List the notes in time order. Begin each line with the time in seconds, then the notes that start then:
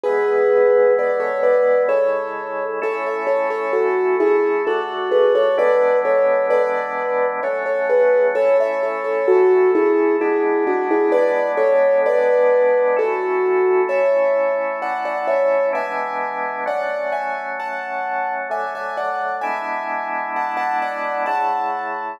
0.03 E3 G#3 B3 G#4 B4
0.99 B4 D5
1.20 A4 C#5
1.43 B4 D5
1.89 C#3 G#3 E4 A4 C#5
2.82 A3 C#4 E4 A4 C#5
3.07 C#5 E5
3.27 A4 C#5
3.50 A4 C#5
3.73 F#4 A4
4.20 E4 G#4
4.67 D3 A3 F#4 A4
5.11 G#4 B4
5.35 A4 C#5
5.58 E3 G#3 B3 D4 B4 D5
6.05 A4 C#5
6.50 B4 D5
7.43 F#3 A3 C#4 A4 C#5
7.66 A4 C#5
7.89 G#4 B4
8.35 A3 C#4 E4 A4 C#5
8.60 C#5 E5
8.83 A4 C#5
9.04 A4 C#5
9.28 F#4 A4
9.75 E4 G#4
10.21 G#3 B3 D4 E4 G#4
10.67 D4 F#4
10.91 E4 G#4
11.12 G#3 B3 D4 B4 D5
11.57 A4 C#5
12.06 B4 D5
12.97 A3 C#4 E4 F#4 A4
13.89 A3 C#4 E4 C#5 E5
14.82 D5 F#5
15.05 D5 F#5
15.28 C#5 E5
15.73 E3 G#3 B3 D4 E5 G#5
16.66 F#3 A3 C#4 D5 F#5
17.12 E5 G#5
17.60 F#5 A5
18.50 D3 F#3 A3 E5 G#5
18.75 E5 G#5
18.97 D5 F#5
19.41 G#3 B3 D4 E4 E5 G#5
20.36 F#5 A5
20.57 F#5 A5
20.82 D5 F#5
21.26 C#3 A3 E4 F#5 A5